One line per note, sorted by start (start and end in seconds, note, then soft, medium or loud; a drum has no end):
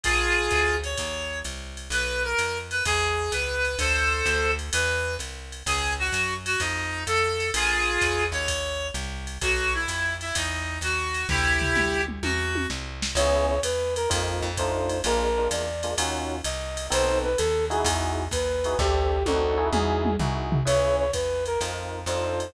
0.04 0.49 A#1 medium
0.04 0.76 F4 loud
0.04 0.76 G#4 loud
0.04 kick medium
0.04 ride loud
0.50 0.95 D2 medium
0.50 kick medium
0.50 hi-hat pedal loud
0.50 ride medium
0.83 1.39 C#5 medium
0.83 ride medium
0.97 1.43 D#2 medium
0.97 kick medium
0.97 ride loud
1.44 1.89 C2 medium
1.44 hi-hat pedal medium
1.44 ride medium
1.77 ride medium
1.90 2.34 B1 medium
1.90 2.22 B4 loud
1.90 ride loud
2.24 2.58 A#4 medium
2.38 2.82 F2 medium
2.38 hi-hat pedal medium
2.38 ride loud
2.71 2.83 B4 medium
2.71 ride medium
2.85 3.30 E2 medium
2.85 3.31 G#4 loud
2.85 kick medium
2.85 ride loud
3.32 3.76 C#2 medium
3.32 3.78 B4 medium
3.32 hi-hat pedal loud
3.32 ride medium
3.65 ride medium
3.79 4.23 D2 medium
3.79 4.51 A4 medium
3.79 4.51 C5 loud
3.79 kick medium
3.79 ride loud
4.25 4.70 D2 medium
4.25 hi-hat pedal medium
4.25 ride medium
4.59 ride medium
4.73 5.17 E2 medium
4.73 5.15 B4 medium
4.73 ride loud
5.19 5.63 C2 medium
5.19 hi-hat pedal medium
5.19 ride medium
5.52 ride medium
5.66 6.10 C#2 medium
5.66 5.93 G#4 loud
5.66 kick medium
5.66 ride loud
5.99 6.34 F#4 loud
6.12 6.56 F#2 medium
6.12 hi-hat pedal loud
6.12 ride loud
6.46 6.60 F#4 loud
6.46 ride loud
6.60 7.05 F2 medium
6.60 7.03 D#4 loud
6.60 kick medium
6.60 ride loud
7.06 7.51 F2 medium
7.06 7.50 A4 loud
7.06 hi-hat pedal loud
7.06 ride loud
7.40 ride medium
7.54 7.98 A#1 medium
7.54 8.24 F4 medium
7.54 8.24 G#4 loud
7.54 ride loud
8.01 8.33 E2 medium
8.01 kick medium
8.01 hi-hat pedal loud
8.01 ride loud
8.32 8.91 D#2 medium
8.32 8.87 C#5 loud
8.32 ride medium
8.48 kick medium
8.48 ride loud
8.94 9.38 C2 medium
8.94 hi-hat pedal medium
8.94 ride medium
9.27 ride medium
9.41 9.86 B1 medium
9.41 9.73 F#4 loud
9.41 kick medium
9.41 ride loud
9.74 10.14 E4 medium
9.88 10.32 F2 medium
9.88 hi-hat pedal medium
9.88 ride loud
10.21 10.35 E4 medium
10.21 ride medium
10.35 10.79 E2 medium
10.35 10.78 D#4 medium
10.35 kick medium
10.35 ride loud
10.81 11.25 D#2 medium
10.81 11.27 F#4 loud
10.81 hi-hat pedal medium
10.81 ride loud
11.14 ride medium
11.29 11.73 D2 loud
11.29 12.01 E4 loud
11.29 12.01 G4 loud
11.29 kick medium
11.29 floor tom medium
11.62 floor tom medium
11.75 12.20 D2 medium
11.75 mid tom medium
12.08 mid tom medium
12.23 12.67 E2 medium
12.23 12.66 F#4 loud
12.23 high tom loud
12.55 high tom loud
12.70 13.14 C2 medium
12.70 snare loud
13.02 snare loud
13.15 13.59 C#2 loud
13.15 13.55 B3 loud
13.15 13.55 C#4 loud
13.15 13.55 E4 loud
13.15 13.55 G#4 loud
13.15 13.46 C#5 loud
13.15 ride loud
13.49 13.60 C#5 medium
13.63 14.07 E2 medium
13.63 13.94 B4 medium
13.63 hi-hat pedal loud
13.63 ride loud
13.96 14.09 A#4 medium
13.96 ride medium
14.10 14.42 F2 loud
14.10 14.48 A#3 loud
14.10 14.48 C4 loud
14.10 14.48 D#4 loud
14.10 14.48 F4 loud
14.10 kick medium
14.10 ride loud
14.42 15.02 F2 loud
14.57 14.97 A3 loud
14.57 14.97 D4 loud
14.57 14.97 D#4 loud
14.57 14.97 F4 loud
14.57 15.01 C5 medium
14.57 kick medium
14.57 hi-hat pedal medium
14.57 ride loud
14.89 ride medium
15.04 15.48 A#1 loud
15.04 15.28 G#3 loud
15.04 15.28 A#3 loud
15.04 15.28 D4 loud
15.04 15.28 F4 loud
15.04 15.48 A#4 medium
15.04 ride loud
15.38 15.65 G#3 loud
15.38 15.65 A#3 loud
15.38 15.65 D4 loud
15.38 15.65 F4 loud
15.51 15.95 E2 medium
15.51 15.95 D5 medium
15.51 hi-hat pedal loud
15.51 ride loud
15.83 15.94 G#3 loud
15.83 15.94 A#3 loud
15.83 15.94 D4 loud
15.83 15.94 F4 loud
15.83 ride medium
15.98 16.42 D#2 medium
15.98 16.36 C#4 loud
15.98 16.36 D#4 loud
15.98 16.36 F4 loud
15.98 16.36 F#4 loud
15.98 ride loud
16.44 16.89 C2 medium
16.44 16.87 D#5 medium
16.44 hi-hat pedal loud
16.44 ride loud
16.77 ride loud
16.90 17.36 B1 loud
16.90 17.28 B3 loud
16.90 17.28 C4 loud
16.90 17.28 D#4 loud
16.90 17.28 A4 loud
16.90 17.18 C5 loud
16.90 ride loud
17.24 17.38 B4 medium
17.38 17.83 D#2 medium
17.38 17.65 A4 medium
17.38 hi-hat pedal loud
17.38 ride loud
17.70 18.23 D#4 loud
17.70 18.23 E4 loud
17.70 18.23 F#4 loud
17.70 18.23 G#4 loud
17.70 17.85 G#4 medium
17.70 ride medium
17.84 18.28 E2 loud
17.84 kick medium
17.84 ride loud
18.31 18.75 D#2 medium
18.31 18.78 B4 medium
18.31 kick medium
18.31 hi-hat pedal medium
18.31 ride loud
18.64 18.75 D#4 loud
18.64 18.75 E4 medium
18.64 18.75 F#4 loud
18.64 18.75 G#4 loud
18.64 ride medium
18.79 19.23 D2 loud
18.79 19.17 C4 loud
18.79 19.17 D4 loud
18.79 19.17 G4 loud
18.79 19.23 G4 medium
18.79 19.17 A4 loud
18.79 kick loud
18.79 snare medium
19.26 19.71 D2 loud
19.26 19.58 C4 loud
19.26 19.58 D4 loud
19.26 19.57 D#4 loud
19.26 19.57 F#4 loud
19.26 19.68 A4 medium
19.26 high tom loud
19.57 20.10 D#4 loud
19.57 20.10 E4 loud
19.57 20.10 F#4 loud
19.57 20.10 G#4 loud
19.72 20.17 E2 loud
19.72 20.14 G#4 medium
19.72 mid tom loud
20.05 mid tom loud
20.19 20.63 C2 medium
20.19 20.58 D#4 loud
20.19 20.58 E4 loud
20.19 20.58 F#4 loud
20.19 20.58 G#4 loud
20.19 floor tom loud
20.52 floor tom loud
20.65 21.11 C#2 medium
20.65 21.03 C#4 loud
20.65 21.03 E4 loud
20.65 21.03 G#4 loud
20.65 21.03 B4 loud
20.65 20.96 C#5 loud
20.65 ride loud
20.99 21.11 C#5 medium
21.13 21.57 E2 medium
21.13 21.44 B4 medium
21.13 kick medium
21.13 hi-hat pedal medium
21.13 ride loud
21.46 21.60 A#4 medium
21.46 ride medium
21.61 22.05 F2 medium
21.61 21.99 C4 loud
21.61 21.99 D#4 loud
21.61 21.99 F4 loud
21.61 21.99 A#4 loud
21.61 ride loud
22.06 22.51 F2 medium
22.06 22.45 D4 loud
22.06 22.45 D#4 loud
22.06 22.45 F4 loud
22.06 22.45 A4 loud
22.06 22.50 C5 medium
22.06 hi-hat pedal medium
22.06 ride loud
22.40 ride medium